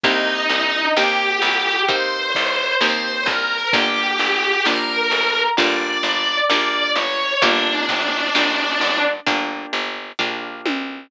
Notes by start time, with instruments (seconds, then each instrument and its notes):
0.03 electric bass (finger) C2, acoustic guitar (steel) A#3 C4 D#4 G4, distortion guitar D#4 D#5, kick, closed hi-hat
0.49 electric bass (finger) C2, closed hi-hat
0.97 electric bass (finger) D#2, acoustic guitar (steel) A#3 C4 D#4 G4, distortion guitar G4 G5, snare
1.42 electric bass (finger) C2, closed hi-hat
1.88 acoustic guitar (steel) A#3 C4 D#4 G4, distortion guitar C5 C6, kick, closed hi-hat
2.35 electric bass (finger) C2, kick, closed hi-hat
2.81 electric bass (finger) D#2, acoustic guitar (steel) A#3 C4 D#4 G4, distortion guitar C5 C6, snare
3.26 electric bass (finger) C2, distortion guitar A#4 A#5, kick, closed hi-hat
3.73 electric bass (finger) G1, acoustic guitar (steel) A#3 D4 F4 G4, distortion guitar G4 G5, kick, closed hi-hat
4.19 electric bass (finger) G1, closed hi-hat
4.65 electric bass (finger) A#1, acoustic guitar (steel) A#3 D4 F4 G4, distortion guitar A#4 A#5, snare
5.11 electric bass (finger) G1, closed hi-hat
5.57 electric bass (finger) G1, acoustic guitar (steel) A#3 D4 F4 G4, distortion guitar D5 D6, kick, closed hi-hat
6.03 electric bass (finger) G1, closed hi-hat
6.49 electric bass (finger) A#1, acoustic guitar (steel) A#3 D4 F4 G4, distortion guitar D5 D6, snare
6.95 electric bass (finger) G1, distortion guitar C#5 C#6, closed hi-hat
7.42 electric bass (finger) G1, acoustic guitar (steel) A#3 D4 F4 G4, distortion guitar D4 D5, kick, closed hi-hat
7.89 electric bass (finger) G1, kick, closed hi-hat
8.35 electric bass (finger) A#1, acoustic guitar (steel) A#3 D4 F4 G4, snare
8.81 electric bass (finger) G1, closed hi-hat
9.26 electric bass (finger) G1, acoustic guitar (steel) A#3 D4 F4 G4, kick, closed hi-hat
9.73 electric bass (finger) G1, closed hi-hat
10.19 electric bass (finger) A#1, acoustic guitar (steel) A#3 D4 F4 G4, kick, floor tom
10.66 electric bass (finger) B1, high tom